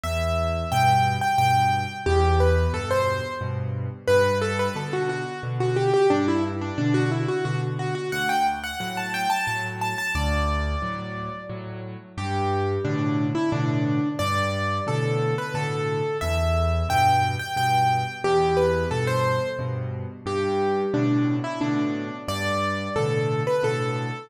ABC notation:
X:1
M:3/4
L:1/16
Q:1/4=89
K:G
V:1 name="Acoustic Grand Piano"
e4 g3 g g4 | G2 B2 A c3 z4 | B2 A B A F F2 z F G G | D E z D D F E F F z F F |
f g z f f a g a a z a a | d8 z4 | G4 D3 E D4 | d4 A3 B A4 |
e4 g3 g g4 | G2 B2 A c3 z4 | G4 D3 E D4 | d4 A3 B A4 |]
V:2 name="Acoustic Grand Piano" clef=bass
E,,4 [G,,B,,]4 [G,,B,,]4 | E,,4 [G,,B,,]4 [G,,B,,]4 | G,,4 [B,,D,]4 [B,,D,]4 | G,,4 [B,,D,]4 [B,,D,]4 |
D,,4 [A,,F,]4 [A,,F,]4 | D,,4 [A,,F,]4 [A,,F,]4 | G,,4 [A,,B,,D,]4 [A,,B,,D,]4 | G,,4 [A,,B,,D,]4 [A,,B,,D,]4 |
E,,4 [G,,B,,]4 [G,,B,,]4 | E,,4 [G,,B,,]4 [G,,B,,]4 | G,,4 [A,,B,,D,]4 [A,,B,,D,]4 | G,,4 [A,,B,,D,]4 [A,,B,,D,]4 |]